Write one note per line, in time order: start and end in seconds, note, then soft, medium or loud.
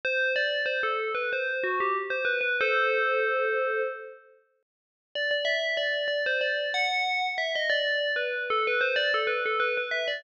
0.05 0.32 C5 loud
0.36 0.62 D5 medium
0.66 0.81 C5 medium
0.83 1.11 A4 medium
1.14 1.30 B4 medium
1.33 1.63 C5 medium
1.63 1.79 F#4 medium
1.80 1.95 G4 medium
2.10 2.25 C5 medium
2.25 2.40 B4 medium
2.41 2.56 B4 medium
2.61 3.81 A4 medium
2.61 3.81 C5 medium
5.15 5.30 D5 medium
5.31 5.46 D5 medium
5.45 5.74 E5 medium
5.77 6.07 D5 medium
6.08 6.23 D5 medium
6.26 6.41 C5 medium
6.41 6.69 D5 medium
6.74 7.26 F#5 loud
7.38 7.53 E5 medium
7.55 7.71 D#5 medium
7.70 8.12 D5 medium
8.16 8.43 B4 medium
8.50 8.65 A4 medium
8.67 8.82 B4 medium
8.81 8.96 C5 medium
8.96 9.11 D5 loud
9.14 9.29 A4 medium
9.27 9.42 B4 medium
9.46 9.61 A4 medium
9.60 9.75 B4 medium
9.77 9.93 B4 medium
9.91 10.06 E5 medium
10.08 10.23 D5 medium